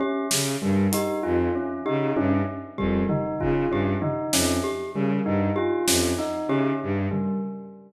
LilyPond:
<<
  \new Staff \with { instrumentName = "Violin" } { \clef bass \time 6/4 \tempo 4 = 97 r8 des8 g,8 r8 f,8 r8 des8 g,8 r8 f,8 r8 des8 | g,8 r8 f,8 r8 des8 g,8 r8 f,8 r8 des8 g,8 r8 | }
  \new Staff \with { instrumentName = "Tubular Bells" } { \time 6/4 des'8 r8 g8 ees'8 f'8 des'8 ees'8 des'8 r8 g8 ees'8 f'8 | des'8 ees'8 des'8 r8 g8 ees'8 f'8 des'8 ees'8 des'8 r8 g8 | }
  \new Staff \with { instrumentName = "Glockenspiel" } { \time 6/4 g'8 r4 g'8 r4 g'8 r4 g'8 r4 | g'8 r4 g'8 r4 g'8 r4 g'8 r4 | }
  \new DrumStaff \with { instrumentName = "Drums" } \drummode { \time 6/4 r8 sn8 r8 hh8 r4 r8 tommh8 r8 bd8 tomfh8 bd8 | r8 tomfh8 sn4 r4 r8 sn8 hc4 r8 tomfh8 | }
>>